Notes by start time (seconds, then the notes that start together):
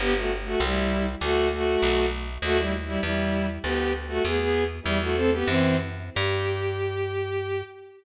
0.00 G1 B3 G4
0.17 A3 F#4
0.45 A3 F#4
0.60 C2 G3 E4
1.21 D2 A3 F#4
1.53 A3 F#4
1.82 B1
2.42 D#2 A3 F#4
2.58 G3 E4
2.86 G3 E4
3.03 E2 G3 E4
3.63 D2 B3 G4
4.08 A3 F#4
4.24 E2 B3 G#4
4.39 B3 G#4
4.83 E2 G3 E4
5.01 A3 F#4
5.15 C4 A4
5.33 B3 G4
5.46 F#2 E3 C4
6.15 G2 G4